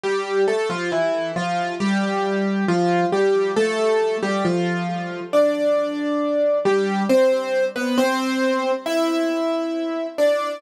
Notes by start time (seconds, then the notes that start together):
0.03 G3 G4
0.48 A3 A4
0.70 F3 F4
0.92 E3 E4
1.36 F3 F4
1.80 G3 G4
2.68 F3 F4
3.12 G3 G4
3.56 A3 A4
4.22 G3 G4
4.45 F3 F4
5.33 D4 D5
6.65 G3 G4
7.09 C4 C5
7.76 B3 B4
7.98 C4 C5
8.86 E4 E5
10.18 D4 D5